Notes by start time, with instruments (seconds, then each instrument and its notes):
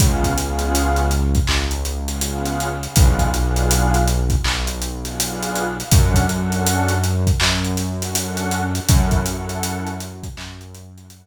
0.00 synth bass 1 C#2, pad 2 (warm) B3 C#4 F4 G#4, kick, closed hi-hat
0.24 kick, closed hi-hat
0.38 pad 2 (warm) B3 C#4 F4 G#4, closed hi-hat
0.59 closed hi-hat
0.75 closed hi-hat
0.96 closed hi-hat
1.11 closed hi-hat
1.35 kick, closed hi-hat
1.47 synth bass 1 C#2, clap
1.71 closed hi-hat
1.85 closed hi-hat
2.08 pad 2 (warm) B3 C#4 F4 G#4, closed hi-hat
2.21 pad 2 (warm) B3 C#4 F4 G#4, closed hi-hat
2.45 closed hi-hat
2.60 closed hi-hat
2.83 pad 2 (warm) B3 C#4 F4 G#4, closed hi-hat
2.96 synth bass 1 B1, pad 2 (warm) B3 D4 F4 G#4, kick, closed hi-hat
3.19 kick, closed hi-hat
3.33 pad 2 (warm) B3 D4 F4 G#4, closed hi-hat
3.56 closed hi-hat
3.71 closed hi-hat
3.94 closed hi-hat
4.08 closed hi-hat
4.30 kick, closed hi-hat
4.44 synth bass 1 B1, clap
4.67 closed hi-hat
4.82 closed hi-hat
5.05 pad 2 (warm) B3 D4 F4 G#4, closed hi-hat
5.18 pad 2 (warm) B3 D4 F4 G#4, closed hi-hat
5.42 closed hi-hat
5.55 closed hi-hat
5.79 pad 2 (warm) B3 D4 F4 G#4, closed hi-hat
5.92 synth bass 1 F#2, pad 2 (warm) C#4 D4 F#4 A4, kick, closed hi-hat
6.14 kick, closed hi-hat
6.29 pad 2 (warm) C#4 D4 F#4 A4, closed hi-hat
6.52 closed hi-hat
6.67 closed hi-hat
6.88 closed hi-hat
7.04 closed hi-hat
7.27 kick, closed hi-hat
7.40 synth bass 1 F#2, clap
7.65 closed hi-hat
7.77 snare, closed hi-hat
8.01 pad 2 (warm) C#4 D4 F#4 A4, closed hi-hat
8.15 pad 2 (warm) C#4 D4 F#4 A4, closed hi-hat
8.37 closed hi-hat
8.51 closed hi-hat
8.75 pad 2 (warm) C#4 D4 F#4 A4, closed hi-hat
8.89 synth bass 1 F#2, pad 2 (warm) C#4 E4 F#4 A4, kick, closed hi-hat
9.11 kick, closed hi-hat
9.25 pad 2 (warm) C#4 E4 F#4 A4, closed hi-hat
9.49 closed hi-hat
9.63 closed hi-hat
9.87 closed hi-hat
10.00 closed hi-hat
10.23 kick, closed hi-hat
10.37 synth bass 1 F#2, clap
10.61 closed hi-hat
10.75 closed hi-hat
10.96 pad 2 (warm) C#4 E4 F#4 A4, closed hi-hat
11.10 pad 2 (warm) C#4 E4 F#4 A4, closed hi-hat